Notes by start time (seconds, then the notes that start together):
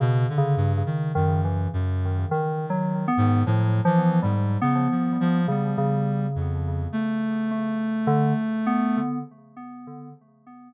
0.00 B2 C#3
0.29 D3
0.38 C#3
0.57 G2
0.77 C#3
0.86 D#3
1.15 F#2 D#3
1.44 E3
1.73 F#2
2.31 D#3
2.70 F#3
3.08 B3
3.17 G#2
3.46 A2 F3
3.85 E3 F3
4.22 G#2 G3
4.62 C#3 B3
4.91 F3
5.20 F3
5.48 C#3 G3
5.78 C#3
6.35 F2
6.92 A3
7.51 A3
8.07 D3
8.67 B3